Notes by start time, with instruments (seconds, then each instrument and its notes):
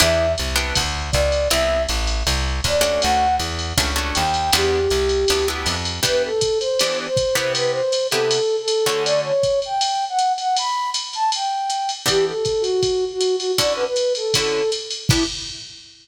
0.00 electric bass (finger) E2, acoustic guitar (steel) B3 D4 E4 G4, flute E5, ride
0.38 electric bass (finger) C2, hi-hat pedal, ride
0.56 acoustic guitar (steel) B3 D4 E4 G4, ride
0.75 electric bass (finger) D2, kick, ride
1.12 electric bass (finger) C#2, flute D5, kick, hi-hat pedal, ride
1.32 ride
1.50 electric bass (finger) C2, acoustic guitar (steel) B3 C4 E4 G4, flute E5, ride
1.89 electric bass (finger) A1, hi-hat pedal, ride
2.07 ride
2.27 electric bass (finger) C2, ride
2.64 electric bass (finger) D#2, flute D5, kick, hi-hat pedal, ride
2.81 acoustic guitar (steel) A3 C#4 D4 F#4, ride
3.02 electric bass (finger) D2, flute F#5, ride
3.39 electric bass (finger) E2, hi-hat pedal, ride
3.59 ride
3.77 electric bass (finger) C#2, acoustic guitar (steel) A3 C#4 D4 F#4, kick, ride
3.96 acoustic guitar (steel) A3 C#4 D4 F#4
4.15 electric bass (finger) D#2, flute G5, hi-hat pedal, ride
4.34 ride
4.53 electric bass (finger) E2, acoustic guitar (steel) B3 D4 E4 G4, flute G4, ride
4.90 electric bass (finger) C2, hi-hat pedal, ride
5.09 ride
5.28 electric bass (finger) D2, acoustic guitar (steel) B3 D4 E4 G4, ride
5.48 acoustic guitar (steel) B3 D4 E4 G4
5.66 electric bass (finger) F2, hi-hat pedal, ride
5.85 ride
6.03 acoustic guitar (steel) E3 B3 D4 G4, kick, ride
6.07 flute B4
6.25 flute A4
6.41 kick, hi-hat pedal, ride
6.60 flute C5, ride
6.79 acoustic guitar (steel) E3 B3 D4 G4, ride
7.08 flute C5
7.17 kick, hi-hat pedal, ride
7.35 acoustic guitar (steel) C3 B3 E4 G4, flute C5, ride
7.55 flute B4, ride
7.71 flute C5
7.92 hi-hat pedal, ride
8.11 acoustic guitar (steel) C3 B3 E4 G4, flute A4, ride
8.31 ride
8.62 flute A4
8.68 hi-hat pedal, ride
8.85 acoustic guitar (steel) D3 A3 C#4 F#4, flute A4, ride
9.05 flute D5, ride
9.25 flute C#5
9.43 kick, hi-hat pedal, ride
9.62 flute G5, ride
9.81 ride
10.09 flute F#5
10.19 hi-hat pedal, ride
10.38 flute F#5, ride
10.57 flute B5, ride
10.94 hi-hat pedal, ride
11.13 flute A5, ride
11.32 flute G5, ride
11.70 hi-hat pedal, ride
11.89 ride
12.06 acoustic guitar (steel) E3 B3 D4 G4, flute G4, kick, ride
12.27 flute A4
12.45 kick, hi-hat pedal, ride
12.61 flute F#4, ride
12.83 kick, ride
13.13 flute F#4
13.21 hi-hat pedal, ride
13.36 flute F#4, ride
13.58 acoustic guitar (steel) D3 C#4 E4 F#4, flute D5, kick, ride
13.76 flute B4
13.86 flute B4
13.96 hi-hat pedal, ride
14.15 flute A4, ride
14.34 acoustic guitar (steel) D3 C#4 E4 F#4, flute A4, kick, ride
14.72 hi-hat pedal, ride
14.91 ride
15.09 acoustic guitar (steel) B3 D4 E4 G4, flute E4, kick, crash